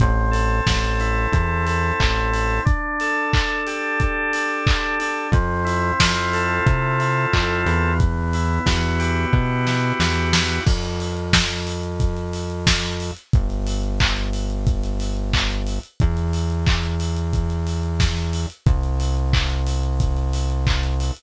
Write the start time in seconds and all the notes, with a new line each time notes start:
0.00 A1 C4, kick, closed hi-hat
0.31 A4, open hi-hat
0.66 A1 C4, kick, snare
1.00 E4, open hi-hat
1.32 E2 C4, kick, closed hi-hat
1.66 A4, open hi-hat
2.00 A1 E4, kick, clap
2.33 C4, open hi-hat
2.65 D4, kick, closed hi-hat
3.00 A4, open hi-hat
3.33 D4, kick, clap
3.67 G4, open hi-hat
4.00 D4, kick, closed hi-hat
4.33 A4, open hi-hat
4.66 G4, kick, clap
4.99 D4, open hi-hat
5.32 F2 C4, kick, closed hi-hat
5.65 E4, open hi-hat
5.99 F2 F4, kick, snare
6.33 A4, open hi-hat
6.66 C3 C4, kick, closed hi-hat
6.99 E4, open hi-hat
7.33 F2 F4, kick, clap
7.66 E2 B3, open hi-hat
8.00 kick, closed hi-hat
8.33 E4, open hi-hat
8.66 E2 F#4, kick, snare
8.99 G4, open hi-hat
9.33 B2 B3, kick
9.67 E4, snare
10.00 E2 F#4, snare
10.33 G4, snare
10.66 F2, kick, crash
10.83 closed hi-hat
11.00 open hi-hat
11.17 closed hi-hat
11.33 kick, snare
11.50 closed hi-hat
11.67 open hi-hat
11.83 closed hi-hat
12.00 kick, closed hi-hat
12.17 closed hi-hat
12.33 open hi-hat
12.50 closed hi-hat
12.67 kick, snare
12.83 closed hi-hat
13.00 open hi-hat
13.17 closed hi-hat
13.33 G1, kick, closed hi-hat
13.50 closed hi-hat
13.67 open hi-hat
13.83 closed hi-hat
14.00 kick, clap
14.17 closed hi-hat
14.33 open hi-hat
14.50 closed hi-hat
14.67 kick, closed hi-hat
14.83 closed hi-hat
15.00 open hi-hat
15.17 closed hi-hat
15.33 kick, clap
15.50 closed hi-hat
15.67 open hi-hat
15.83 closed hi-hat
16.00 E2, kick, closed hi-hat
16.17 closed hi-hat
16.33 open hi-hat
16.50 closed hi-hat
16.67 kick, clap
16.83 closed hi-hat
17.00 open hi-hat
17.17 closed hi-hat
17.33 kick, closed hi-hat
17.50 closed hi-hat
17.67 open hi-hat
17.83 closed hi-hat
18.00 kick, snare
18.17 closed hi-hat
18.33 open hi-hat
18.50 closed hi-hat
18.66 C2, kick, closed hi-hat
18.83 closed hi-hat
19.00 open hi-hat
19.17 closed hi-hat
19.33 kick, clap
19.50 closed hi-hat
19.67 open hi-hat
19.83 closed hi-hat
20.00 kick, closed hi-hat
20.17 closed hi-hat
20.33 open hi-hat
20.50 closed hi-hat
20.67 kick, clap
20.83 closed hi-hat
21.00 open hi-hat
21.17 closed hi-hat